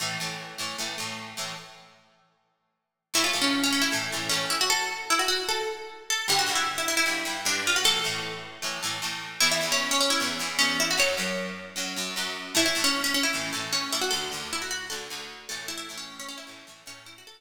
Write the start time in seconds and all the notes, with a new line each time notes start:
0.00 A2 E3 A3
0.20 A2 E3 A3
0.58 A2 E3 A3
0.78 A2 E3 A3
0.98 A2 E3 A3
1.37 A2 E3 A3
3.14 A2 E3 A3 E4
3.24 F4
3.33 A2 E3 A3
3.42 C#4
3.63 C#4
3.73 C#4
3.82 E4
3.92 A2 E3 A3
4.12 A2 E3 A3
4.29 A2 E3 A3 C#4
4.50 E4
4.61 F#4
4.70 A4
5.10 E4
5.19 F#4
5.28 F#4
5.49 A4
6.10 A4
6.28 G2 D3 G3 G4
6.39 F#4
6.47 G2 D3 G3
6.55 E4
6.78 E4
6.88 E4
6.97 E4
7.06 G2 D3 G3
7.25 G2 D3 G3
7.45 G2 D3 G3 D4
7.67 F4
7.76 F#4
7.84 A2 E3 A3 A4
8.04 A2 E3 A3
8.62 A2 E3 A3
8.83 A2 E3 A3
9.02 A2 E3 A3
9.40 E2 E3 B3 E4
9.51 E4
9.61 E2 E3 B3
9.72 C#4
9.91 C#4
10.00 C#4
10.10 E4
10.20 E2 E3 B3
10.39 E2 E3 B3
10.59 E2 E3 B3 C#4
10.80 E4
10.91 F#4
10.97 F#2 F#3 C#4 C#5
11.17 F#2 F#3 C#4
11.76 F#2 F#3 C#4
11.96 F#2 F#3 C#4
12.16 F#2 F#3 C#4
12.55 A2 E3 A3 E4
12.66 E4
12.75 A2 E3 A3
12.84 C#4
13.04 C#4
13.14 C#4
13.23 E4
13.33 A2 E3 A3
13.53 A2 E3 A3
13.73 C#4
13.92 A2 E3 A3 E4
14.01 F#4
14.11 D2 D3 A3 A4
14.32 D2 D3 A3
14.53 E4
14.62 F#4
14.71 F#4
14.90 D2 D3 A3 A4
15.10 D2 D3 A3
15.49 A2 E3 A3 A4
15.68 E4
15.78 E4
15.89 A2 E3 A3
15.98 C#4
16.20 C#4
16.29 C#4
16.38 E4
16.47 A2 E3 A3
16.67 A2 E3 A3
16.86 A2 E3 A3 C#4
17.06 E4
17.18 F#4
17.27 A4